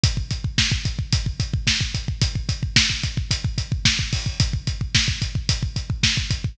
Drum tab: HH |x-x---x-x-x---x-|x-x---x-x-x---o-|x-x---x-x-x---x-|
SD |----o-------o---|----o-------o---|----o-------o---|
BD |oooooooooooooooo|oooooooooooooooo|oooooooooooooooo|